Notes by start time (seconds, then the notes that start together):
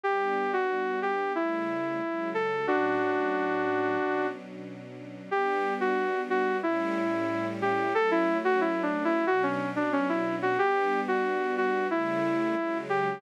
0.04 G3 B3 D4 G4
0.53 F#4
1.02 G4
1.35 C#3 G3 A3 E4
2.01 C#3 F#3 G#3
2.34 A4
2.67 A2 F#3 C#4 D4 F#4
3.99 B2 F#3 C#4 D4
5.31 G3 B3 D4 G4
5.80 F#4
6.30 F#4
6.63 A2 G3 C#4 E4
7.62 G4
7.95 F#3 A3 C#4 A4
8.11 E4
8.45 F#4
8.61 E4
8.83 D4
9.05 E4
9.27 B2 F#3 C#4 D4 F#4
9.43 C#4
9.76 D4
9.93 C#4
10.09 E4
10.42 F#4
10.59 G3 B3 D4 G4
11.08 F#4
11.57 F#4
11.90 C#3 G3 A3 E4
12.57 C#3 F#3 G#3
12.89 G4